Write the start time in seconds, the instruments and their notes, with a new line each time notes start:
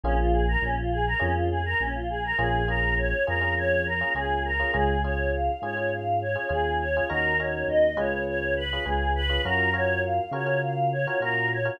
0.03 synth bass 1 A#1, electric piano 1 A#3 C#4 F4 G#4, choir aahs C#4
0.18 choir aahs F4
0.33 choir aahs G#4
0.48 choir aahs A#4
0.62 synth bass 1 A#1, choir aahs C#4
0.77 choir aahs F4
0.92 choir aahs G#4
1.07 choir aahs A#4
1.19 synth bass 1 F2, electric piano 1 A#3 C#4 F4 G#4, choir aahs C#4
1.36 choir aahs F4
1.51 choir aahs G#4
1.65 choir aahs A#4
1.80 synth bass 1 A#1, choir aahs C#4
1.95 choir aahs F4
2.10 choir aahs G#4
2.24 choir aahs A#4
2.38 synth bass 1 A#1, electric piano 1 A#3 C#4 F4 G#4, choir aahs G#4
2.68 electric piano 1 A#3 C#4 F4 G#4, choir aahs A#4
2.98 choir aahs C#5
3.27 synth bass 1 F2, electric piano 1 A#3 C#4 F4 G#4, choir aahs A#4
3.41 electric piano 1 A#3 C#4 F4 G#4
3.57 choir aahs C#5
3.86 choir aahs A#4
4.01 electric piano 1 A#3 C#4 F4 G#4
4.15 synth bass 1 C#2, electric piano 1 A#3 C#4 F4 G#4, choir aahs G#4
4.45 choir aahs A#4
4.59 electric piano 1 A#3 C#4 F4 G#4
4.74 synth bass 1 C#2, electric piano 1 C#4 F4 G#4, choir aahs G#4
5.04 electric piano 1 C#4 F4 G#4, choir aahs C#5
5.33 choir aahs F5
5.62 synth bass 1 G#2, electric piano 1 C#4 F4 G#4, choir aahs C#5
5.77 electric piano 1 C#4 F4 G#4
5.92 choir aahs F5
6.21 choir aahs C#5
6.35 electric piano 1 C#4 F4 G#4
6.49 synth bass 1 D#2, electric piano 1 C#4 F4 G#4, choir aahs G#4
6.80 choir aahs C#5
6.96 electric piano 1 C#4 F4 G#4
7.09 synth bass 1 D#2, electric piano 1 C#4 D#4 F#4 A#4, choir aahs A#4
7.39 electric piano 1 C#4 D#4 F#4 A#4, choir aahs C#5
7.68 synth bass 1 D#2, choir aahs D#5
7.96 synth bass 1 C#2, electric piano 1 C#4 F4 G#4 B4, choir aahs C#5
8.27 choir aahs C#5
8.57 choir aahs B4
8.73 electric piano 1 C#4 F4 G#4 B4
8.85 synth bass 1 C#2, electric piano 1 C#4 F4 G#4 B4, choir aahs G#4
9.15 choir aahs B4
9.29 electric piano 1 C#4 F4 G#4 B4
9.45 synth bass 1 F#2, electric piano 1 C#4 F4 F#4 A#4, choir aahs A#4
9.74 electric piano 1 C#4 F4 F#4 A#4, choir aahs C#5
10.04 choir aahs F5
10.31 synth bass 1 C#3, electric piano 1 C#4 F4 F#4 A#4, choir aahs C#5
10.46 electric piano 1 C#4 F4 F#4 A#4
10.63 choir aahs F5
10.92 choir aahs C#5
11.07 electric piano 1 C#4 F4 F#4 A#4
11.20 synth bass 1 A#2, electric piano 1 C#4 F4 F#4 A#4, choir aahs A#4
11.51 choir aahs C#5
11.65 electric piano 1 C#4 F4 F#4 A#4